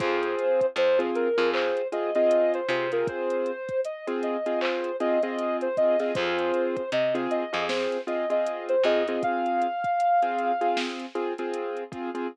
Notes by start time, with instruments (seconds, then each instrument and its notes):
0.00 electric bass (finger) F2, acoustic grand piano C4 F4 G#4, ocarina C5, kick, closed hi-hat
0.23 closed hi-hat
0.39 closed hi-hat
0.61 kick, closed hi-hat
0.76 electric bass (finger) F2, ocarina C5, closed hi-hat
0.99 acoustic grand piano C4 F4 G#4, closed hi-hat
1.15 ocarina A#4, closed hi-hat
1.38 electric bass (finger) F2, acoustic grand piano C4 F4 G#4, closed hi-hat
1.54 ocarina C5, clap
1.77 closed hi-hat
1.92 acoustic grand piano C4 F4 G#4, ocarina D#5, closed hi-hat
2.15 acoustic grand piano C4 F4 G#4, ocarina D#5, closed hi-hat
2.31 closed hi-hat
2.54 ocarina C5, closed hi-hat
2.69 electric bass (finger) C3, acoustic grand piano C4 F4 G#4, ocarina C5, closed hi-hat
2.92 acoustic grand piano C4 F4 G#4, ocarina A#4, closed hi-hat
3.07 ocarina C5, kick, closed hi-hat
3.30 closed hi-hat
3.46 closed hi-hat
3.69 kick, closed hi-hat
3.85 ocarina D#5, closed hi-hat
4.07 acoustic grand piano C4 F4 G#4, closed hi-hat
4.23 ocarina D#5, closed hi-hat
4.46 acoustic grand piano C4 F4 G#4, closed hi-hat
4.61 ocarina C5, clap
4.84 closed hi-hat
5.00 acoustic grand piano C4 F4 G#4, ocarina D#5, closed hi-hat
5.23 acoustic grand piano C4 F4 G#4, ocarina D#5, closed hi-hat
5.39 closed hi-hat
5.61 ocarina C5, closed hi-hat
5.77 acoustic grand piano C4 F4 G#4, ocarina D#5, kick, closed hi-hat
6.00 acoustic grand piano C4 F4 G#4, ocarina D#5, snare, closed hi-hat
6.15 electric bass (finger) F2, acoustic grand piano C4 F4 G#4, ocarina C5, kick, closed hi-hat
6.38 closed hi-hat
6.54 closed hi-hat
6.77 kick, closed hi-hat
6.92 electric bass (finger) C3, ocarina D#5, closed hi-hat
7.15 acoustic grand piano C4 F4 G#4, closed hi-hat
7.31 ocarina D#5, closed hi-hat
7.53 electric bass (finger) F2, acoustic grand piano C4 F4 G#4, closed hi-hat
7.69 ocarina C5, snare
7.92 closed hi-hat
8.07 acoustic grand piano C4 F4 G#4, ocarina D#5, closed hi-hat
8.30 acoustic grand piano C4 F4 G#4, ocarina D#5, closed hi-hat
8.46 closed hi-hat
8.69 ocarina C5, closed hi-hat
8.83 electric bass (finger) F2, acoustic grand piano C4 F4 G#4, ocarina D#5, closed hi-hat
9.07 acoustic grand piano C4 F4 G#4, ocarina D#5, closed hi-hat
9.23 ocarina F5, kick, closed hi-hat
9.46 closed hi-hat
9.62 closed hi-hat
9.84 kick, closed hi-hat
10.00 closed hi-hat
10.22 acoustic grand piano C4 F4 G#4, closed hi-hat
10.38 closed hi-hat
10.61 acoustic grand piano C4 F4 G#4, closed hi-hat
10.77 snare
11.00 closed hi-hat
11.15 acoustic grand piano C4 F4 G#4, closed hi-hat
11.38 acoustic grand piano C4 F4 G#4, closed hi-hat
11.54 closed hi-hat
11.77 closed hi-hat
11.92 acoustic grand piano C4 F4 G#4, kick, closed hi-hat
12.15 acoustic grand piano C4 F4 G#4, closed hi-hat